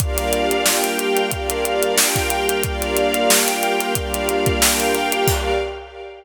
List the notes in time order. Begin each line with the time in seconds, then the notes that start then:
0.00 G3 A#3 D4 F4 G4 A#4 D5 F5, kick, closed hi-hat
0.18 snare, closed hi-hat
0.33 closed hi-hat
0.51 closed hi-hat
0.66 G4 A#4 F5 G5, snare
0.84 closed hi-hat
0.99 closed hi-hat
1.17 closed hi-hat
1.31 G3 A#3 D4 F4 G4 A#4 D5 F5, kick, closed hi-hat
1.50 closed hi-hat
1.65 closed hi-hat
1.83 closed hi-hat
1.98 G4 A#4 F5 G5, snare
2.16 kick, snare, closed hi-hat
2.30 closed hi-hat
2.49 closed hi-hat
2.63 G3 A#3 D4 F4 G4 A#4 D5 F5, kick, closed hi-hat
2.82 closed hi-hat
2.97 closed hi-hat
3.14 closed hi-hat
3.30 G4 A#4 F5 G5, snare
3.48 closed hi-hat
3.63 closed hi-hat
3.80 snare, closed hi-hat
3.95 G3 A#3 D4 F4 G4 A#4 D5 F5, kick, closed hi-hat
4.14 closed hi-hat
4.29 closed hi-hat
4.46 kick, closed hi-hat
4.61 G4 A#4 F5 G5, snare
4.80 closed hi-hat
4.94 snare, closed hi-hat
5.12 closed hi-hat
5.27 G3 A#3 D4 F4 G4 A#4 D5 F5, kick, crash